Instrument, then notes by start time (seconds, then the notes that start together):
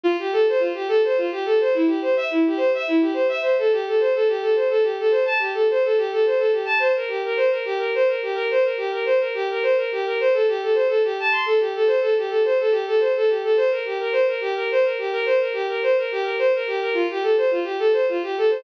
violin
0.04 F4
0.19 G4
0.33 A4
0.49 C5
0.59 F4
0.74 G4
0.88 A4
1.04 C5
1.17 F4
1.31 G4
1.45 A4
1.60 C5
1.74 E4
1.87 G4
2.02 C5
2.17 E5
2.31 E4
2.46 G4
2.57 C5
2.74 E5
2.88 E4
3.01 G4
3.13 C5
3.29 E5
3.41 C5
3.58 A4
3.72 G4
3.87 A4
4.00 C5
4.14 A4
4.28 G4
4.41 A4
4.55 C5
4.70 A4
4.83 G4
4.99 A4
5.11 C5
5.25 A5
5.39 G4
5.54 A4
5.70 C5
5.84 A4
5.97 G4
6.12 A4
6.26 C5
6.38 A4
6.52 G4
6.65 A5
6.79 C5
6.96 A#4
7.08 G4
7.25 A#4
7.37 C5
7.50 A#4
7.65 G4
7.78 A#4
7.95 C5
8.08 A#4
8.22 G4
8.35 A#4
8.51 C5
8.63 A#4
8.77 G4
8.91 A#4
9.06 C5
9.20 A#4
9.34 G4
9.50 A#4
9.63 C5
9.77 A#4
9.92 G4
10.05 A#4
10.20 C5
10.33 A4
10.48 G4
10.62 A4
10.74 C5
10.88 A4
11.04 G4
11.19 A5
11.31 C6
11.45 A4
11.60 G4
11.75 A4
11.87 C5
12.01 A4
12.17 G4
12.29 A4
12.45 C5
12.60 A4
12.71 G4
12.87 A4
13.00 C5
13.16 A4
13.29 G4
13.43 A4
13.57 C5
13.71 A#4
13.85 G4
14.00 A#4
14.12 C5
14.27 A#4
14.41 G4
14.55 A#4
14.71 C5
14.84 A#4
14.98 G4
15.12 A#4
15.25 C5
15.40 A#4
15.53 G4
15.68 A#4
15.83 C5
15.98 A#4
16.12 G4
16.23 A#4
16.38 C5
16.55 A#4
16.67 G4
16.81 A#4
16.94 F4
17.10 G4
17.23 A4
17.37 C5
17.51 F4
17.64 G4
17.79 A4
17.93 C5
18.09 F4
18.23 G4
18.38 A4
18.50 C5